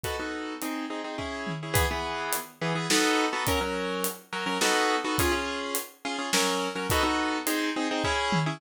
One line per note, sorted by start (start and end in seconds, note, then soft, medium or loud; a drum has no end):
0.03 0.16 B3 loud
0.03 0.16 D#4 loud
0.03 0.16 F#4 loud
0.03 0.16 A4 loud
0.03 kick medium
0.03 closed hi-hat medium
0.20 0.54 B3 medium
0.20 0.54 D#4 medium
0.20 0.54 F#4 medium
0.20 0.54 A4 medium
0.62 0.85 C4 loud
0.62 0.85 D#4 loud
0.62 0.85 G#4 medium
0.62 closed hi-hat medium
0.90 1.01 C4 medium
0.90 1.01 D#4 medium
0.90 1.01 G#4 medium
1.04 1.16 C4 medium
1.04 1.16 D#4 medium
1.04 1.16 G#4 medium
1.18 1.52 C#4 loud
1.18 1.52 E4 medium
1.18 1.52 G#4 loud
1.18 kick medium
1.47 mid tom medium
1.63 1.74 C#4 medium
1.63 1.74 E4 medium
1.63 1.73 G#4 medium
1.74 1.85 E3 loud
1.74 1.85 B3 loud
1.74 1.85 G#4 loud
1.74 kick loud
1.74 closed hi-hat loud
1.91 2.36 E3 loud
1.91 2.36 B3 loud
1.91 2.36 G#4 loud
2.33 closed hi-hat loud
2.61 2.73 E3 loud
2.61 2.73 B3 loud
2.61 2.73 G#4 loud
2.75 2.87 E3 loud
2.75 2.87 B3 loud
2.75 2.87 G#4 loud
2.90 3.25 B3 loud
2.90 3.25 D#4 loud
2.90 3.25 F#4 loud
2.90 3.25 A4 loud
2.90 snare loud
3.33 3.44 B3 loud
3.33 3.44 D#4 loud
3.33 3.44 F#4 loud
3.33 3.44 A4 loud
3.47 3.59 F#3 loud
3.47 3.59 C#4 loud
3.47 3.59 A#4 loud
3.47 kick loud
3.47 closed hi-hat loud
3.61 4.07 F#3 loud
3.61 4.07 C#4 loud
3.61 4.07 A#4 loud
4.04 closed hi-hat loud
4.33 4.44 F#3 loud
4.33 4.44 C#4 loud
4.33 4.44 A#4 loud
4.46 4.58 F#3 loud
4.46 4.58 C#4 loud
4.46 4.58 A#4 loud
4.61 4.96 B3 loud
4.61 4.96 D#4 loud
4.61 4.96 F#4 loud
4.61 4.96 A4 loud
4.61 snare loud
5.04 5.16 B3 loud
5.04 5.16 D#4 loud
5.04 5.16 F#4 loud
5.04 5.16 A4 loud
5.18 5.31 C#4 loud
5.18 5.31 F4 loud
5.18 5.31 G#4 loud
5.18 kick loud
5.18 closed hi-hat loud
5.32 5.77 C#4 loud
5.32 5.77 F4 loud
5.32 5.77 G#4 loud
5.75 closed hi-hat loud
6.05 6.16 C#4 loud
6.05 6.16 F4 loud
6.05 6.16 G#4 loud
6.19 6.30 C#4 loud
6.19 6.30 F4 loud
6.19 6.30 G#4 loud
6.33 6.68 F#3 loud
6.33 6.68 C#4 loud
6.33 6.68 A#4 loud
6.33 snare loud
6.75 6.87 F#3 loud
6.75 6.87 C#4 loud
6.75 6.87 A#4 loud
6.90 7.03 B3 loud
6.90 7.03 D#4 loud
6.90 7.03 F#4 loud
6.90 7.03 A4 loud
6.90 kick loud
6.90 closed hi-hat loud
7.03 7.38 B3 loud
7.03 7.38 D#4 loud
7.03 7.38 F#4 loud
7.03 7.38 A4 loud
7.47 7.69 C4 loud
7.47 7.69 D#4 loud
7.47 7.69 G#4 loud
7.47 closed hi-hat loud
7.76 7.88 C4 loud
7.76 7.88 D#4 loud
7.76 7.88 G#4 loud
7.91 8.02 C4 loud
7.91 8.02 D#4 loud
7.91 8.02 G#4 loud
8.04 8.39 C#4 loud
8.04 8.39 E4 loud
8.04 8.39 G#4 loud
8.04 kick medium
8.32 mid tom loud
8.46 8.58 C#4 loud
8.46 8.58 E4 loud
8.46 8.58 G#4 loud